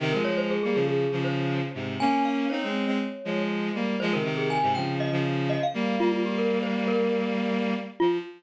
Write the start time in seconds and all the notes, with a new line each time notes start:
0.00 C3 D#3
0.13 F3 G#3 A#4
0.25 F3 G#3 C#5
0.37 C5
0.51 G#4
0.63 G3 A#3 G#4
0.74 C#3 F3 G#4
0.88 G#4
1.12 C#3 F3
1.24 C5
1.74 G#2 C3
2.00 A#3 C#4 G#5
2.25 F5
2.50 C4 D#4 C#5
2.63 G#3 C4
2.86 G#3 C4
3.25 F3 G#3
3.74 G3 A#3
4.00 F3 G#3 C5
4.13 C3 D#3 A#4
4.24 C3 D#3
4.37 G#4
4.50 G#5
4.63 G#2 C3
4.75 C#3 F3 G5
5.00 D#5
5.11 C#3 F3
5.50 D#5
5.63 F5
5.74 G3 A#3
6.00 G3 A#3 F4
6.12 F4
6.25 G4
6.38 A#4
6.63 C5
6.88 A#4
8.00 F3 F4